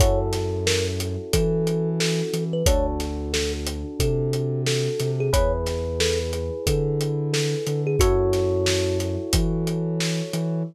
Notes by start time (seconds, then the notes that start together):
0.00 F#2 C#4 E4 F#4 A4 C#5, kick, closed hi-hat
0.33 snare, closed hi-hat
0.67 A#4, snare
1.00 closed hi-hat
1.33 E3 A4, kick, closed hi-hat
1.67 closed hi-hat
2.00 A4, snare
2.33 E3, closed hi-hat
2.53 B4
2.66 D2 D4 F#4 A4 C#5, kick, closed hi-hat
3.00 snare, closed hi-hat
3.33 A4, snare
3.67 closed hi-hat
4.00 C3 A4, kick, closed hi-hat
4.33 closed hi-hat
4.67 A4, snare
5.00 C3, snare, closed hi-hat
5.20 G#4
5.33 E2 E4 G#4 B4 C#5, kick, closed hi-hat
5.66 snare, closed hi-hat
6.00 A4, snare
6.33 closed hi-hat
6.67 D3 A4, kick, closed hi-hat
7.01 closed hi-hat
7.33 A4, snare
7.67 D3, closed hi-hat
7.87 G#4
7.99 F#2 E4 F#4 A4 C#5, kick, closed hi-hat
8.33 snare, closed hi-hat
8.66 snare
9.00 snare, closed hi-hat
9.33 E3, kick, closed hi-hat
9.67 closed hi-hat
10.00 snare
10.33 E3, closed hi-hat